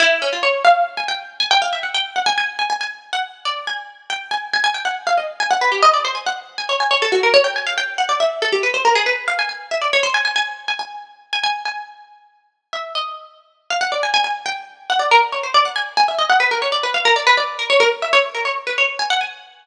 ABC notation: X:1
M:6/8
L:1/16
Q:3/8=93
K:none
V:1 name="Pizzicato Strings"
E2 _D F _d2 f2 z _a g2 | z _a g f e _g =g2 _g a a2 | _a a a z2 _g z2 d2 a2 | z2 g2 _a2 a a g _g z f |
_e z _a _g B =G e d c a _g z | z _a _d a d =A _G _B d =g _a f | g2 _g d e2 A =G B c _B _A | B2 f _a a2 e d _d c a a |
_a3 a a5 a a2 | _a10 e2 | _e6 z f _g d _a a | _a2 g2 z2 _g d _B z _d c |
d _g _a z a e _e g B _B _d =d | B f _B d =B d2 _B _d B z e | _d z _B d z =B d2 _a _g a2 |]